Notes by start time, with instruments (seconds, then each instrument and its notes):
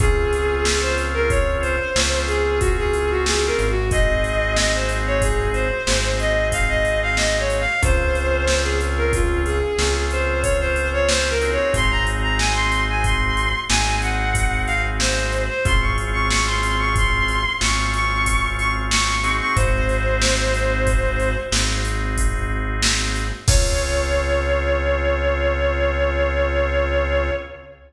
0.00 synth bass 1 C#2, drawbar organ C4 C#4 F4 G#4, violin G#4, kick, closed hi-hat
0.33 closed hi-hat
0.65 violin G#4, snare
0.81 violin C5
0.98 closed hi-hat
1.14 violin A#4
1.30 violin C#5, kick, closed hi-hat
1.61 violin C5, closed hi-hat
1.96 synth bass 1 C#2, drawbar organ C4 C#4 F4 G#4, snare
2.27 violin G#4, closed hi-hat
2.60 violin F#4, kick, closed hi-hat
2.78 violin G#4
2.93 closed hi-hat
3.10 violin F#4
3.26 violin G#4, snare
3.46 violin A#4
3.59 synth bass 1 G#1, closed hi-hat
3.70 violin F#4
3.91 drawbar organ C4 D#4 F#4 G#4, violin D#5, kick, closed hi-hat
4.24 closed hi-hat
4.56 violin D#5, snare
4.74 violin C5
4.89 closed hi-hat
5.07 violin C#5
5.22 violin G#4, kick, closed hi-hat
5.53 violin C5, closed hi-hat
5.87 synth bass 1 G#1, drawbar organ C4 D#4 F#4 G#4, snare
6.19 violin D#5, closed hi-hat
6.52 violin F5, kick, closed hi-hat
6.69 violin D#5
6.85 closed hi-hat
7.02 violin F5
7.17 violin D#5, snare
7.39 violin C#5
7.50 closed hi-hat
7.60 violin F5
7.82 synth bass 1 C#2, drawbar organ C4 C#4 F4 G#4, violin C5, kick, closed hi-hat
8.15 closed hi-hat
8.48 violin C5, snare
8.63 violin G#4
8.81 closed hi-hat
8.97 violin A#4
9.13 violin F4, kick, closed hi-hat
9.46 violin G#4, closed hi-hat
9.78 synth bass 1 C#2, drawbar organ C4 C#4 F4 G#4, snare
10.11 violin C5, closed hi-hat
10.42 violin C#5, kick, closed hi-hat
10.60 violin C5
10.76 closed hi-hat
10.93 violin C#5
11.08 violin C5, snare
11.30 violin A#4
11.41 drawbar organ C4 D#4 F#4 G#4, closed hi-hat
11.52 violin C#5
11.74 synth bass 1 G#1, violin C6, kick, closed hi-hat
11.91 violin A#5
12.07 closed hi-hat
12.23 violin A#5
12.38 violin G#5, snare
12.54 violin C6
12.72 closed hi-hat
12.89 violin G#5
13.04 violin C6, kick, closed hi-hat
13.37 closed hi-hat
13.69 synth bass 1 G#1, drawbar organ C4 D#4 F#4 G#4, violin G#5, snare
14.02 violin F#5, closed hi-hat
14.35 kick, closed hi-hat
14.66 violin F5, closed hi-hat
15.00 violin C5, snare
15.32 closed hi-hat
15.49 violin C5
15.65 synth bass 1 G#1, drawbar organ C4 C#4 F4 G#4, violin C6, kick, closed hi-hat
15.81 violin C#6
15.98 closed hi-hat
16.13 violin C#6
16.29 violin C#6, snare
16.46 violin C6
16.63 closed hi-hat
16.79 violin C#6
16.96 violin C6, kick, closed hi-hat
17.28 closed hi-hat
17.61 synth bass 1 G#1, drawbar organ C4 C#4 F4 G#4, violin C#6, snare
17.93 violin C#6, closed hi-hat
18.26 kick, closed hi-hat
18.58 violin C#6, closed hi-hat
18.91 violin C#6, snare
19.24 drawbar organ C4 D#4 F#4 G#4, closed hi-hat
19.40 violin C#6
19.56 synth bass 1 G#1, violin C5, kick, closed hi-hat
19.89 closed hi-hat
20.22 snare
20.54 closed hi-hat
20.87 kick, closed hi-hat
21.20 closed hi-hat
21.51 synth bass 1 G#1, drawbar organ C4 D#4 F#4 G#4, snare
21.85 closed hi-hat
22.17 kick, closed hi-hat
22.82 snare
23.15 closed hi-hat
23.47 synth bass 1 C#2, drawbar organ C4 C#4 F4 G#4, violin C#5, kick, crash